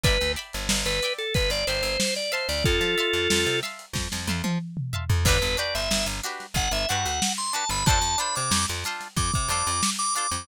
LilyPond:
<<
  \new Staff \with { instrumentName = "Drawbar Organ" } { \time 4/4 \key g \mixolydian \tempo 4 = 92 b'8 r8. b'8 a'16 b'16 d''16 c''8. d''16 c''16 d''16 | <f' a'>4. r2 r8 | b'8 d''16 e''8 r8. fis''16 e''16 fis''8. c'''16 a''16 b''16 | a''8 b''16 d'''8 r8. d'''16 d'''16 d'''8. d'''16 d'''16 d'''16 | }
  \new Staff \with { instrumentName = "Acoustic Guitar (steel)" } { \time 4/4 \key g \mixolydian <d'' e'' g'' b''>8 <d'' e'' g'' b''>4 <d'' e'' g'' b''>4 <d'' e'' g'' b''>4 <e'' f'' a'' c'''>8~ | <e'' f'' a'' c'''>8 <e'' f'' a'' c'''>4 <e'' f'' a'' c'''>4 <e'' f'' a'' c'''>4 <e'' f'' a'' c'''>8 | <d' fis' g' b'>8 <d' fis' g' b'>4 <d' fis' g' b'>4 <d' fis' g' b'>4 <d' fis' g' b'>8 | <d' f' a' c''>8 <d' f' a' c''>4 <d' f' a' c''>4 <d' f' a' c''>4 <d' f' a' c''>8 | }
  \new Staff \with { instrumentName = "Electric Bass (finger)" } { \clef bass \time 4/4 \key g \mixolydian g,,16 d,8 g,,16 g,,16 g,,8. g,,16 g,,16 g,,16 g,,4 d,16 | f,16 f8 f,16 f,16 c8. f,16 f,16 f,16 f4 f,16 | g,,16 g,,8 g,,16 g,,16 g,,8. g,,16 g,,16 g,16 d,4 g,,16 | f,16 f,8 c16 f,16 f,8. f,16 c16 f,16 f,4 f,16 | }
  \new DrumStaff \with { instrumentName = "Drums" } \drummode { \time 4/4 <hh bd>16 hh16 hh16 hh16 sn16 hh16 hh16 hh16 <hh bd>16 hh16 hh16 hh16 sn16 <hh sn>16 hh16 hho16 | <hh bd>16 <hh sn>16 hh16 hh16 sn16 hh16 <hh sn>16 hh16 <bd sn>16 sn16 tommh16 tommh16 r16 toml16 tomfh16 tomfh16 | <cymc bd>16 hh16 hh16 hh16 sn16 hh16 hh16 <hh sn>16 <hh bd>16 hh16 hh16 hh16 sn16 hh16 hh16 hho16 | <hh bd>16 hh16 hh16 hh16 sn16 <hh sn>16 <hh sn>16 <hh sn>16 <hh bd>16 <hh bd>16 <hh sn>16 hh16 sn16 hh16 hh16 <hh sn>16 | }
>>